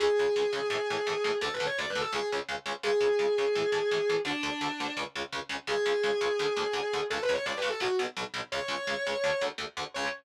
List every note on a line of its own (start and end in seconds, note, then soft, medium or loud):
0.00 0.08 C#2 medium
0.00 0.08 C#3 loud
0.00 0.08 G#3 loud
0.00 1.33 G#4 loud
0.19 0.26 C#2 medium
0.19 0.26 C#3 medium
0.19 0.26 G#3 medium
0.36 0.43 C#2 medium
0.36 0.43 C#3 medium
0.36 0.43 G#3 medium
0.53 0.60 C#2 medium
0.53 0.60 C#3 medium
0.53 0.60 G#3 medium
0.70 0.77 A2 loud
0.70 0.77 E3 loud
0.70 0.77 A3 medium
0.90 0.97 A2 medium
0.90 0.97 E3 medium
0.90 0.97 A3 medium
1.07 1.14 A2 medium
1.07 1.14 E3 medium
1.07 1.14 A3 medium
1.24 1.31 A2 medium
1.24 1.31 E3 medium
1.24 1.31 A3 medium
1.41 1.48 D2 loud
1.41 1.48 D3 loud
1.41 1.48 A3 medium
1.41 1.54 A4 loud
1.54 1.65 B4 medium
1.60 1.67 D2 medium
1.60 1.67 D3 medium
1.60 1.67 A3 medium
1.66 1.77 C#5 medium
1.78 1.86 D2 medium
1.78 1.86 D3 medium
1.78 1.86 A3 medium
1.78 1.89 D5 loud
1.90 2.01 B4 medium
1.95 2.03 D2 medium
1.95 2.03 D3 medium
1.95 2.03 A3 medium
2.01 2.12 A4 loud
2.13 2.20 C#2 medium
2.13 2.20 C#3 loud
2.13 2.20 G#3 medium
2.13 2.28 G#4 loud
2.32 2.39 C#2 medium
2.32 2.39 C#3 medium
2.32 2.39 G#3 medium
2.49 2.56 C#2 medium
2.49 2.56 C#3 medium
2.49 2.56 G#3 medium
2.66 2.73 C#2 medium
2.66 2.73 C#3 medium
2.66 2.73 G#3 medium
2.83 2.90 C#2 loud
2.83 2.90 C#3 loud
2.83 2.90 G#3 loud
2.83 4.14 G#4 loud
3.01 3.08 C#2 medium
3.01 3.08 C#3 medium
3.01 3.08 G#3 medium
3.19 3.26 C#2 medium
3.19 3.26 C#3 medium
3.19 3.26 G#3 medium
3.38 3.45 C#2 medium
3.38 3.45 C#3 medium
3.38 3.45 G#3 medium
3.55 3.63 A2 loud
3.55 3.63 E3 loud
3.55 3.63 A3 medium
3.72 3.79 A2 medium
3.72 3.79 E3 medium
3.72 3.79 A3 medium
3.91 3.98 A2 medium
3.91 3.98 E3 medium
3.91 3.98 A3 medium
4.09 4.17 A2 medium
4.09 4.17 E3 medium
4.09 4.17 A3 medium
4.25 4.32 D2 loud
4.25 4.32 D3 loud
4.25 4.32 A3 medium
4.25 4.93 D4 loud
4.43 4.50 D2 medium
4.43 4.50 D3 medium
4.43 4.50 A3 medium
4.61 4.68 D2 medium
4.61 4.68 D3 medium
4.61 4.68 A3 medium
4.80 4.87 D2 medium
4.80 4.87 D3 medium
4.80 4.87 A3 medium
4.97 5.04 C#2 loud
4.97 5.04 C#3 medium
4.97 5.04 G#3 medium
5.16 5.23 C#2 medium
5.16 5.23 C#3 medium
5.16 5.23 G#3 medium
5.32 5.40 C#2 medium
5.32 5.40 C#3 medium
5.32 5.40 G#3 medium
5.49 5.56 C#2 medium
5.49 5.56 C#3 medium
5.49 5.56 G#3 medium
5.67 5.74 C#2 loud
5.67 5.74 C#3 medium
5.67 5.74 G#3 medium
5.67 7.00 G#4 loud
5.86 5.93 C#2 medium
5.86 5.93 C#3 medium
5.86 5.93 G#3 medium
6.03 6.11 C#2 medium
6.03 6.11 C#3 medium
6.03 6.11 G#3 medium
6.21 6.28 C#2 medium
6.21 6.28 C#3 medium
6.21 6.28 G#3 medium
6.39 6.46 D2 medium
6.39 6.46 D3 loud
6.39 6.46 A3 loud
6.57 6.64 D2 medium
6.57 6.64 D3 medium
6.57 6.64 A3 medium
6.73 6.80 D2 medium
6.73 6.80 D3 medium
6.73 6.80 A3 medium
6.93 7.00 D2 medium
6.93 7.00 D3 medium
6.93 7.00 A3 medium
7.10 7.18 C#2 medium
7.10 7.18 C#3 medium
7.10 7.18 G#3 loud
7.10 7.22 A4 loud
7.22 7.33 B4 loud
7.29 7.36 C#2 medium
7.29 7.36 C#3 medium
7.29 7.36 G#3 medium
7.33 7.45 C#5 loud
7.46 7.53 C#2 medium
7.46 7.53 C#3 medium
7.46 7.53 G#3 medium
7.46 7.57 D5 medium
7.57 7.68 B4 medium
7.62 7.69 C#2 medium
7.62 7.69 C#3 medium
7.62 7.69 G#3 medium
7.69 7.81 A4 loud
7.80 7.87 B1 loud
7.80 7.87 B2 loud
7.80 7.87 F#3 loud
7.80 7.96 F#4 medium
7.99 8.06 B1 medium
7.99 8.06 B2 medium
7.99 8.06 F#3 medium
8.17 8.24 B1 medium
8.17 8.24 B2 medium
8.17 8.24 F#3 medium
8.34 8.41 B1 medium
8.34 8.41 B2 medium
8.34 8.41 F#3 medium
8.52 8.59 C#2 loud
8.52 8.59 C#3 loud
8.52 8.59 G#3 loud
8.52 9.41 C#5 loud
8.68 8.75 C#2 medium
8.68 8.75 C#3 medium
8.68 8.75 G#3 medium
8.87 8.94 C#2 medium
8.87 8.94 C#3 medium
8.87 8.94 G#3 medium
9.07 9.14 C#2 medium
9.07 9.14 C#3 medium
9.07 9.14 G#3 medium
9.24 9.31 D2 loud
9.24 9.31 D3 medium
9.24 9.31 A3 medium
9.41 9.49 D2 medium
9.41 9.49 D3 medium
9.41 9.49 A3 medium
9.58 9.65 D2 medium
9.58 9.65 D3 medium
9.58 9.65 A3 medium
9.77 9.84 D2 medium
9.77 9.84 D3 medium
9.77 9.84 A3 medium
9.94 10.08 C#2 loud
9.94 10.08 C#3 loud
9.94 10.08 G#3 medium
9.94 10.07 C#5 loud